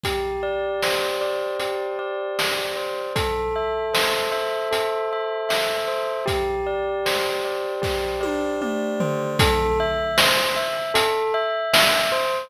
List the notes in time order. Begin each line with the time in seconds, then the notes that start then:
0.04 G4, kick, closed hi-hat
0.43 D5
0.83 C5, snare
1.21 D5
1.60 G4, closed hi-hat
1.99 D5
2.39 D5, snare
2.77 C5
3.16 A4, kick, closed hi-hat
3.56 E5
3.94 C5, snare
4.32 E5
4.71 A4, closed hi-hat
5.13 E5
5.49 E5, snare
5.88 C5
6.26 G4, kick, closed hi-hat
6.67 D5
7.06 C5, snare
7.45 D5
7.82 G4, kick, snare
8.21 D5, high tom
8.62 D5, mid tom
9.00 C5, floor tom
9.39 A4, kick, closed hi-hat
9.80 E5
10.18 C5, snare
10.56 E5
10.94 A4, closed hi-hat
11.34 E5
11.73 E5, snare
12.12 C5